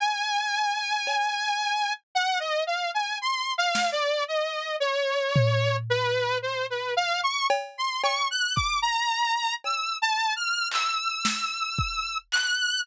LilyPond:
<<
  \new Staff \with { instrumentName = "Lead 2 (sawtooth)" } { \time 6/4 \tempo 4 = 56 gis''2 fis''16 dis''16 f''16 gis''16 \tuplet 3/2 { c'''8 f''8 d''8 } dis''8 cis''4 b'8 | c''16 b'16 f''16 cis'''16 r16 c'''16 cis'''16 fis'''16 d'''16 ais''8. \tuplet 3/2 { e'''8 a''8 f'''8 } e'''4. fis'''8 | }
  \new DrumStaff \with { instrumentName = "Drums" } \drummode { \time 6/4 r4 cb4 r4 r8 sn8 r4 tomfh4 | r4 cb8 cb8 bd4 cb4 hc8 sn8 bd8 hc8 | }
>>